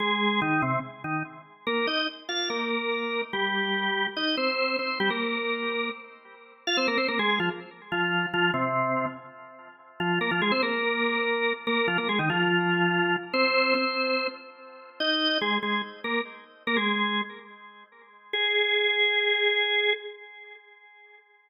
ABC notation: X:1
M:4/4
L:1/16
Q:1/4=144
K:Ab
V:1 name="Drawbar Organ"
[A,A]4 [E,E]2 [C,C]2 z2 [E,E]2 z4 | [B,B]2 [Ee]2 z2 [Ff]2 [B,B]8 | [G,G]8 [Ee]2 [Cc]4 [Cc]2 | [G,G] [B,B]9 z6 |
[K:Fm] [Ff] [Cc] [B,B] [Cc] [B,B] [A,A]2 [F,F] z4 [F,F]4 | [F,F]2 [C,C]6 z8 | [F,F]2 [B,B] [F,F] [A,A] [Cc] [B,B]10 | [B,B]2 [F,F] [B,B] [A,A] [E,E] [F,F]10 |
[Cc]4 [Cc]6 z6 | [K:Ab] [Ee]4 [A,A]2 [A,A]2 z2 [B,B]2 z4 | [B,B] [A,A]5 z10 | A16 |]